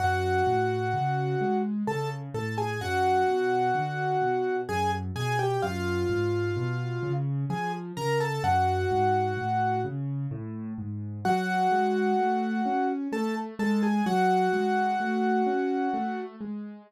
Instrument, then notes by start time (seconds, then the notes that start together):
acoustic grand piano
0.00 F#2 F#4 F#5
0.47 A2
0.94 C#3
1.41 G#3
1.87 C#3 A4 A5
2.34 A2 A4 A5
2.58 G#4 G#5
2.81 F#2 F#4 F#5
3.28 B2
3.75 D3
4.22 B2
4.69 F#2 G#4 G#5
5.16 B2 G#4 G#5
5.39 G4 G5
5.62 F#2 F4 F5
6.10 G#2
6.56 B2
7.03 C#3
7.50 F3 G#4 G#5
7.97 C#3 A#4 A#5
8.20 A4 A5
8.44 F#2 F#4 F#5
8.91 G#2
9.37 A2
9.84 C#3
10.31 A2
10.78 G#2
11.25 F#3 F#4 F#5
11.71 G#3
12.19 A3
12.66 C#4
13.12 A3 A4 A5
13.59 G#3 A4 A5
13.83 G#4 G#5
14.06 F#3 F#4 F#5
14.53 G#3
15.00 A3
15.46 C#4
15.94 A3
16.41 G#3